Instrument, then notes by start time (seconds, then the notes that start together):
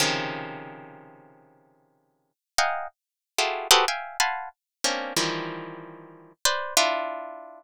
orchestral harp
0.00 C3 C#3 D#3 F3
2.58 D#5 F5 F#5 G5 G#5 A#5
3.38 E4 F4 F#4 G4 G#4 A4
3.71 F#4 G4 G#4 A4 B4 C5
3.88 E5 F5 G5 G#5
4.20 F5 F#5 G#5 A5 B5 C6
4.84 A#3 C4 C#4 D4
5.16 D#3 E3 F3 G3
6.45 B4 C5 D5
6.77 D4 E4 F4